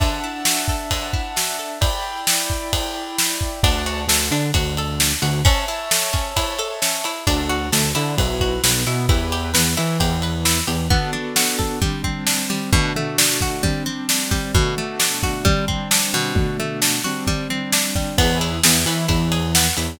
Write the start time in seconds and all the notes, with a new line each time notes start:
0.00 D3 D4 E5 F#5 A5, kick, ride
0.24 E4
0.45 F#4, snare
0.68 A4, kick
0.91 D3, kick, ride
1.13 E4, kick
1.36 F#4, snare
1.59 A4
1.81 E4 D5 G5 B5, kick, ride
2.27 snare
2.50 kick
2.73 kick, ride
3.18 snare
3.41 kick
3.63 D2 D4 D5 F#5 A5, kick, ride
3.86 F#4, ride
4.07 D2 D3 A4, snare
4.31 D3 D4, ride
4.54 D2 D3 F#4, kick, ride
4.77 A4, ride
5.00 D4, snare
5.22 D2 D3 F#4, ride
5.45 C#4 C#5 E5 A5, kick, ride
5.68 E4, ride
5.91 A4, snare
6.13 C#4, kick, ride
6.36 E4, kick, ride
6.59 A4, ride
6.82 C#4, snare
7.04 E4, ride
7.27 D2 D4 F#4 A4, kick, ride
7.49 F#4, ride
7.72 D2 D3 A4, snare
7.95 D3 D4 E4, ride
8.18 B1 E4 F#4 B4, kick, ride
8.41 F#4, kick, ride
8.63 B1 B3 B4, snare
8.86 B2 B3 E4, ride
9.09 E2 E4 G4 B4, kick, ride
9.32 G4, ride
9.54 E2 E3 B4, snare
9.77 E3 E4, ride
10.00 E2 E3 G4, kick, ride
10.22 B4, ride
10.45 E4, snare
10.67 E2 E3 G4, ride
10.90 B3 D4 F#4 A4, kick, floor tom
11.13 D4, floor tom
11.36 F#4, snare
11.59 A4, kick, floor tom
11.81 G3 C4 D4, kick, floor tom
12.04 C4, kick, floor tom
12.27 D4, snare
12.50 G3, floor tom
12.73 B2 A3 D4 F#4, kick, floor tom
12.96 A3, floor tom
13.18 D4, snare
13.41 F#4, kick, floor tom
13.63 G3 C4 D4, kick, floor tom
13.86 C4, floor tom
14.09 D4, snare
14.31 G3, kick, floor tom
14.54 B2 A3 D4 F#4, kick, floor tom
14.77 A3, floor tom
15.00 D4, snare
15.23 F#4, kick, floor tom
15.45 G3 C4 D4, kick, floor tom
15.68 C4, kick, floor tom
15.91 D4, snare
16.14 B2, floor tom
16.35 B2 A3 D4 F#4, kick, floor tom
16.59 A3, floor tom
16.82 D4, snare
17.04 G3 C4 D4 F#4, floor tom
17.27 G3, kick, floor tom
17.50 C4, floor tom
17.72 D4, snare
17.95 G3, kick, floor tom
18.18 E2 B3 E4 G#4 B4, kick, ride
18.41 E4, ride
18.63 E2 E3 G#4, snare
18.86 E3 B3 E4, ride
19.08 E2 E3 E4, kick, ride
19.32 G#4, ride
19.55 B3, snare
19.77 E2 E3 E4, ride